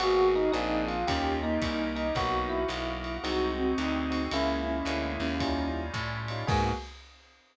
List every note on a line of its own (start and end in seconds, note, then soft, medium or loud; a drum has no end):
0.00 0.50 G#1 loud
0.00 0.41 A#3 medium
0.00 0.53 A#3 medium
0.00 0.41 B3 medium
0.00 0.55 B3 loud
0.00 0.27 F#4 loud
0.00 0.41 F#4 medium
0.00 0.55 F#4 loud
0.00 0.52 F#4 loud
0.00 0.41 G#4 medium
0.00 0.53 G#4 medium
0.00 ride loud
0.35 0.52 D#4 loud
0.52 1.04 A#1 loud
0.52 0.95 A#3 medium
0.52 1.07 A#3 medium
0.52 0.95 C4 medium
0.52 1.07 C4 medium
0.52 0.95 D4 medium
0.52 1.07 D4 loud
0.52 0.85 D#4 loud
0.52 0.95 G#4 medium
0.52 1.07 G#4 medium
0.52 hi-hat pedal medium
0.52 ride medium
0.87 1.06 F4 medium
0.87 ride medium
1.07 1.58 D#2 loud
1.07 1.61 C#4 medium
1.07 1.39 C#4 loud
1.07 1.50 C#4 medium
1.07 1.61 D#4 medium
1.07 1.50 D#4 medium
1.07 1.61 F4 loud
1.07 1.50 F4 medium
1.07 1.61 G4 loud
1.07 1.35 G4 loud
1.07 1.50 G4 medium
1.07 kick medium
1.07 ride loud
1.42 2.07 A#3 medium
1.42 1.94 D#4 loud
1.61 2.11 C2 medium
1.61 2.16 C#4 medium
1.61 2.15 D#4 medium
1.61 2.16 G4 medium
1.61 2.16 A#4 medium
1.61 kick medium
1.61 hi-hat pedal loud
1.61 ride loud
1.96 2.15 D#4 loud
1.96 ride medium
2.15 2.65 B1 loud
2.15 2.69 A#3 medium
2.15 2.58 A#3 medium
2.15 2.69 B3 medium
2.15 2.58 B3 medium
2.15 2.69 D#4 loud
2.15 2.58 D#4 medium
2.15 2.69 F#4 loud
2.15 2.58 F#4 medium
2.15 2.65 F#4 medium
2.15 2.45 F#4 loud
2.15 kick medium
2.15 ride loud
2.49 3.16 E4 loud
2.68 3.18 B1 loud
2.68 3.24 A#3 medium
2.68 3.24 B3 medium
2.68 3.24 F#4 medium
2.68 3.24 A#4 medium
2.68 hi-hat pedal medium
2.68 ride medium
3.04 ride medium
3.23 3.74 C2 loud
3.23 3.65 G#3 medium
3.23 3.78 G#3 medium
3.23 3.65 C4 medium
3.23 3.78 C4 medium
3.23 3.65 D#4 medium
3.23 3.52 D#4 medium
3.23 3.79 D#4 medium
3.23 3.65 F#4 medium
3.23 3.71 F#4 loud
3.23 3.78 F#4 loud
3.23 ride loud
3.58 4.20 C4 medium
3.78 4.28 D2 medium
3.78 4.33 G#3 medium
3.78 4.33 C4 loud
3.78 4.30 D#4 medium
3.78 4.33 F#4 medium
3.78 4.33 G#4 medium
3.78 hi-hat pedal medium
3.78 ride medium
4.10 4.25 G#3 medium
4.10 4.25 C4 medium
4.10 4.25 D#4 medium
4.10 4.25 F#4 medium
4.10 ride loud
4.31 4.82 C#2 loud
4.31 4.75 G#3 medium
4.31 4.87 G#3 medium
4.31 4.75 A#3 medium
4.31 4.87 A#3 medium
4.31 4.61 C#4 loud
4.31 4.75 C#4 medium
4.31 4.87 C#4 medium
4.31 5.84 E4 loud
4.31 4.75 E4 medium
4.31 4.87 E4 medium
4.31 ride loud
4.66 5.12 C#4 medium
4.85 5.17 D2 loud
4.85 5.28 G#3 medium
4.85 5.42 G#3 medium
4.85 5.28 A#3 medium
4.85 5.42 A#3 medium
4.85 5.28 C#4 medium
4.85 5.28 E4 medium
4.85 5.42 E4 medium
4.85 5.42 G#4 medium
4.85 hi-hat pedal loud
4.85 ride loud
5.20 5.90 D#2 loud
5.20 5.68 C#4 loud
5.20 ride medium
5.40 5.94 G3 medium
5.40 5.83 G3 medium
5.40 5.94 C#4 medium
5.40 5.83 C#4 medium
5.40 5.94 D#4 loud
5.40 5.83 D#4 medium
5.40 5.94 F4 medium
5.40 5.83 F4 medium
5.40 kick medium
5.40 ride loud
5.94 6.44 A2 medium
5.94 6.49 G3 loud
5.94 6.49 C#4 medium
5.94 6.49 F4 loud
5.94 6.49 G4 medium
5.94 kick medium
5.94 hi-hat pedal loud
5.94 ride medium
6.28 6.44 G3 medium
6.28 6.44 C#4 medium
6.28 6.44 D#4 medium
6.28 6.44 F4 medium
6.28 ride medium
6.47 6.72 G#2 loud
6.47 6.72 G#3 loud
6.47 6.71 A#3 loud
6.47 6.72 A#3 loud
6.47 6.71 B3 loud
6.47 6.72 B3 loud
6.47 6.71 F#4 loud
6.47 6.72 F#4 loud
6.47 6.71 G#4 loud
6.47 6.72 G#4 loud
6.47 kick loud
6.47 crash loud